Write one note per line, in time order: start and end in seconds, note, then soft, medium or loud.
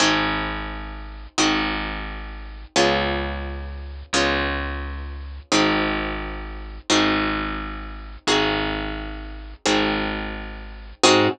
0.00 1.27 G#1 medium
0.00 1.35 C4 medium
0.00 1.35 D#4 medium
0.00 1.35 F#4 medium
0.00 1.35 G#4 medium
1.38 2.65 G#1 medium
1.38 2.73 C4 medium
1.38 2.73 D#4 medium
1.38 2.73 F#4 medium
1.38 2.73 G#4 medium
2.76 4.03 C#2 medium
2.76 4.11 B3 medium
2.76 4.11 C#4 medium
2.76 4.11 F4 medium
2.76 4.11 G#4 medium
4.13 5.40 C#2 medium
4.13 5.49 B3 medium
4.13 5.49 C#4 medium
4.13 5.49 F4 medium
4.13 5.49 G#4 medium
5.52 6.79 G#1 medium
5.52 6.87 C4 medium
5.52 6.87 D#4 medium
5.52 6.87 F#4 medium
5.52 6.87 G#4 medium
6.90 8.17 G#1 medium
6.90 8.25 C4 medium
6.90 8.25 D#4 medium
6.90 8.25 F#4 medium
6.90 8.25 G#4 medium
8.27 9.54 G#1 medium
8.27 9.63 C4 medium
8.27 9.63 D#4 medium
8.27 9.63 F#4 medium
8.27 9.63 G#4 medium
9.66 10.93 G#1 medium
9.66 11.01 C4 medium
9.66 11.01 D#4 medium
9.66 11.01 F#4 medium
9.66 11.01 G#4 medium
11.03 11.28 G#2 loud
11.03 11.28 C4 loud
11.03 11.28 D#4 medium
11.03 11.28 F#4 loud
11.03 11.28 G#4 loud